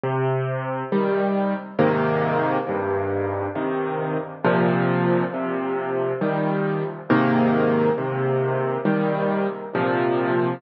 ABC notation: X:1
M:3/4
L:1/8
Q:1/4=68
K:Cm
V:1 name="Acoustic Grand Piano"
C,2 [E,G,]2 [A,,C,E,B,]2 | G,,2 [C,E,]2 [B,,C,F,]2 | C,2 [E,G,]2 [A,,C,E,B,]2 | C,2 [E,G,]2 [B,,C,F,]2 |]